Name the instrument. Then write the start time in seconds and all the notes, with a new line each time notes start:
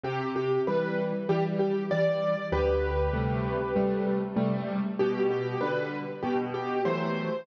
acoustic grand piano
0.03 C3 G4
0.36 G4
0.67 E3 G3 B4
1.29 E3 G3 G4
1.59 G4
1.91 E3 G3 D5
2.52 D2 G4 B4
3.13 C3 G3 A3
3.76 C3 G3 A3
4.36 C3 G3 A3
4.99 B2 G4
5.31 G4
5.61 D3 G3 B4
6.23 B2 G4
6.54 G4
6.85 E3 F#3 A3 C5